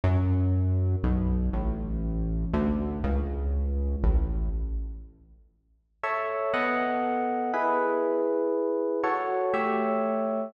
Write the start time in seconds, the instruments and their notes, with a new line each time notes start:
0.04 synth bass 1 F#2
1.03 synth bass 1 B1
1.53 synth bass 1 A1
2.53 synth bass 1 D2
3.04 synth bass 1 C#2
4.04 synth bass 1 A1
6.03 electric piano 1 A4 C#5 E5
6.53 electric piano 1 B3 A4 D#5 F#5
7.53 electric piano 1 E4 G#4 B4
9.03 electric piano 1 F#4 A4 C#5
9.54 electric piano 1 A3 G4 C#5 E5